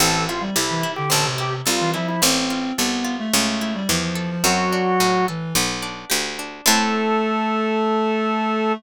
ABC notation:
X:1
M:4/4
L:1/16
Q:1/4=108
K:Am
V:1 name="Drawbar Organ"
A2 F z E3 G A z G z F2 E E | z16 | ^F6 z10 | A16 |]
V:2 name="Clarinet"
E,2 z G, z E, z D, D, C, C,2 z E, F,2 | C4 B,3 A, A,2 A, G, F, F, F, F, | ^F,6 E,2 z8 | A,16 |]
V:3 name="Harpsichord"
C2 E2 A2 E2 C2 E2 A2 E2 | C2 F2 A2 F2 ^C2 E2 G2 A2 | C2 D2 ^F2 A2 B,2 D2 G2 D2 | [CEA]16 |]
V:4 name="Harpsichord" clef=bass
A,,,4 C,,4 A,,,4 C,,4 | A,,,4 C,,4 ^C,,4 E,,4 | ^F,,4 A,,4 B,,,4 D,,4 | A,,16 |]